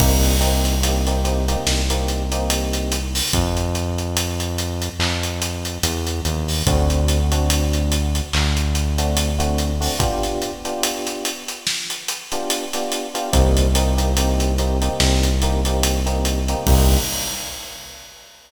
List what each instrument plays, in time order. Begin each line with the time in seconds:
0.00 synth bass 1 C2, electric piano 1 A#3 C4 D#4 G4, kick, crash
0.23 closed hi-hat
0.41 electric piano 1 A#3 C4 D#4 G4, closed hi-hat
0.65 closed hi-hat
0.83 electric piano 1 A#3 C4 D#4 G4, closed hi-hat
1.07 electric piano 1 A#3 C4 D#4 G4, closed hi-hat
1.24 electric piano 1 A#3 C4 D#4 G4, closed hi-hat
1.48 electric piano 1 A#3 C4 D#4 G4, closed hi-hat
1.67 synth bass 1 C2, snare
1.90 electric piano 1 A#3 C4 D#4 G4, closed hi-hat
2.08 closed hi-hat
2.32 electric piano 1 A#3 C4 D#4 G4, closed hi-hat
2.50 closed hi-hat
2.73 closed hi-hat
2.92 closed hi-hat
3.15 open hi-hat
3.33 synth bass 1 F2, kick, closed hi-hat
3.57 closed hi-hat
3.75 closed hi-hat
3.98 closed hi-hat
4.17 closed hi-hat
4.40 closed hi-hat
4.58 closed hi-hat
4.82 closed hi-hat
4.99 synth bass 1 F2, clap
5.23 closed hi-hat
5.42 closed hi-hat
5.65 closed hi-hat
5.83 synth bass 1 E2, closed hi-hat
6.07 closed hi-hat
6.25 synth bass 1 D#2, closed hi-hat
6.48 open hi-hat
6.66 synth bass 1 D2, electric piano 1 A3 C4 D4 F#4, kick, closed hi-hat
6.90 closed hi-hat
7.08 closed hi-hat
7.32 electric piano 1 A3 C4 D4 F#4, closed hi-hat
7.50 closed hi-hat
7.73 closed hi-hat
7.92 closed hi-hat
8.15 closed hi-hat
8.33 synth bass 1 D2, clap
8.57 closed hi-hat
8.75 closed hi-hat
8.98 electric piano 1 A3 C4 D4 F#4, closed hi-hat
9.17 closed hi-hat
9.39 electric piano 1 A3 C4 D4 F#4, closed hi-hat
9.58 closed hi-hat
9.81 electric piano 1 A3 C4 D4 F#4, open hi-hat
9.99 electric piano 1 B3 D4 F4 G4, kick, closed hi-hat
10.23 snare, closed hi-hat
10.42 closed hi-hat
10.65 electric piano 1 B3 D4 F4 G4, closed hi-hat
10.83 closed hi-hat
11.07 closed hi-hat
11.25 closed hi-hat
11.48 closed hi-hat
11.67 snare
11.90 closed hi-hat
12.08 closed hi-hat
12.32 electric piano 1 B3 D4 F4 G4, closed hi-hat
12.50 closed hi-hat
12.73 electric piano 1 B3 D4 F4 G4, snare, closed hi-hat
12.92 closed hi-hat
13.14 electric piano 1 B3 D4 F4 G4, closed hi-hat
13.33 synth bass 1 C2, electric piano 1 A#3 C4 D#4 G4, kick, closed hi-hat
13.57 closed hi-hat
13.75 electric piano 1 A#3 C4 D#4 G4, closed hi-hat
13.97 electric piano 1 A#3 C4 D#4 G4, closed hi-hat
14.17 electric piano 1 A#3 C4 D#4 G4, closed hi-hat
14.40 closed hi-hat
14.58 electric piano 1 A#3 C4 D#4 G4, closed hi-hat
14.82 electric piano 1 A#3 C4 D#4 G4, closed hi-hat
15.00 synth bass 1 C2, snare
15.23 closed hi-hat
15.42 electric piano 1 A#3 C4 D#4 G4, closed hi-hat
15.65 electric piano 1 A#3 C4 D#4 G4, closed hi-hat
15.83 closed hi-hat
16.06 electric piano 1 A#3 C4 D#4 G4, closed hi-hat
16.25 closed hi-hat
16.48 electric piano 1 A#3 C4 D#4 G4, closed hi-hat
16.67 synth bass 1 C2, electric piano 1 A#3 C4 D#4 G4, kick, crash